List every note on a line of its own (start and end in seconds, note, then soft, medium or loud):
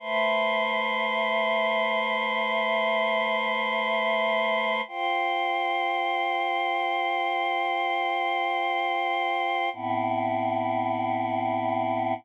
0.00 4.81 A3 medium
0.00 4.81 B4 medium
0.00 4.81 C5 medium
0.00 4.81 E5 medium
4.88 9.69 F4 medium
4.88 9.69 C5 medium
4.88 9.69 G5 medium
9.73 12.14 A2 medium
9.73 12.14 B3 medium
9.73 12.14 C4 medium
9.73 12.14 E4 medium